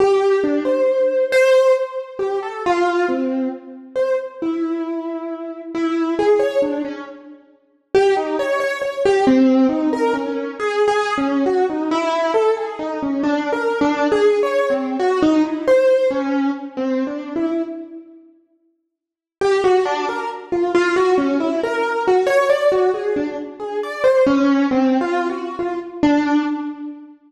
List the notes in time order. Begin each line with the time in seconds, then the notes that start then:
0.00 G4
0.44 D4
0.65 C5
1.32 C5
2.19 G4
2.42 A4
2.66 F4
3.08 C4
3.96 C5
4.42 E4
5.74 E4
6.19 G#4
6.39 C#5
6.62 D4
6.85 C#4
7.94 G4
8.17 D#4
8.39 C#5
8.60 C#5
8.81 C#5
9.05 G4
9.27 C4
9.69 D#4
9.93 A#4
10.14 C#4
10.59 G#4
10.88 G#4
11.17 C#4
11.46 F#4
11.70 D#4
11.91 E4
12.34 A4
12.57 G#4
12.79 D#4
13.02 C#4
13.23 D4
13.52 A#4
13.81 D4
14.12 G#4
14.43 C#5
14.70 C4
14.99 F#4
15.22 D#4
15.44 E4
15.67 C5
16.10 C#4
16.77 C4
17.07 D4
17.36 E4
19.41 G4
19.64 F#4
19.85 D4
20.09 A#4
20.52 F4
20.74 F4
20.96 F#4
21.18 C#4
21.40 E4
21.63 A#4
22.07 F#4
22.26 C#5
22.49 D5
22.72 F#4
22.94 G#4
23.16 D4
23.60 G#4
23.83 D5
24.04 C5
24.26 C#4
24.71 C4
25.01 F4
25.29 F#4
25.59 F4
26.03 D4